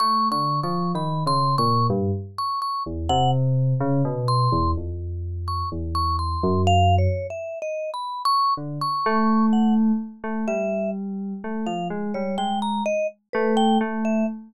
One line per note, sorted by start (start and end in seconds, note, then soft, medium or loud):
0.00 0.29 A3 medium
0.00 0.29 C#6 loud
0.31 0.60 D3 medium
0.31 0.60 C#6 medium
0.63 0.92 F3 medium
0.63 0.92 C#6 medium
0.95 1.23 D#3 medium
0.95 1.24 B5 medium
1.26 1.55 C#3 medium
1.26 1.56 C6 loud
1.58 1.87 A#2 medium
1.58 1.87 C#6 loud
1.90 2.11 G2 loud
2.38 2.60 C#6 medium
2.62 2.83 C#6 medium
2.86 3.08 E2 medium
3.09 3.74 C3 loud
3.09 3.31 F#5 loud
3.80 4.02 C#3 loud
4.05 4.48 B2 loud
4.28 4.71 C6 medium
4.52 4.74 E2 medium
4.77 5.63 F2 medium
5.48 5.69 C#6 medium
5.72 6.36 E2 medium
5.95 6.16 C#6 medium
6.19 6.62 C6 medium
6.43 7.08 F#2 loud
6.67 6.96 F5 loud
6.98 7.27 C#5 medium
7.30 7.59 E5 medium
7.62 7.90 D#5 medium
7.94 8.22 B5 medium
8.25 8.54 C#6 loud
8.57 8.79 D3 medium
8.81 9.46 C#6 medium
9.06 9.92 A3 loud
9.53 9.74 F#5 medium
10.24 10.45 A3 medium
10.48 11.33 G3 medium
10.48 10.90 E5 medium
11.44 11.65 A3 medium
11.66 11.88 F3 medium
11.66 11.88 F5 medium
11.90 12.12 G#3 medium
12.14 12.36 G3 medium
12.14 12.36 C#5 medium
12.38 12.81 G#3 medium
12.38 12.59 G5 medium
12.62 12.84 A#5 medium
12.86 13.07 D#5 medium
13.33 13.77 A3 loud
13.33 13.55 B4 medium
13.57 13.78 G5 loud
13.81 14.24 A3 loud
14.05 14.26 E5 medium